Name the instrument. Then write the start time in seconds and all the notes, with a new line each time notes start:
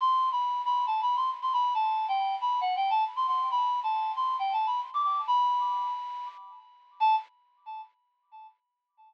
electric piano 2
0.01 C6
0.32 B5
0.65 B5
0.87 A5
1.02 B5
1.16 C6
1.42 C6
1.53 B5
1.74 A5
2.08 G5
2.41 B5
2.61 F#5
2.76 G5
2.90 A5
3.16 C6
3.28 C6
3.51 B5
3.83 A5
4.16 C6
4.39 G5
4.53 A5
4.67 B5
4.94 D6
5.03 D6
5.27 B5
7.00 A5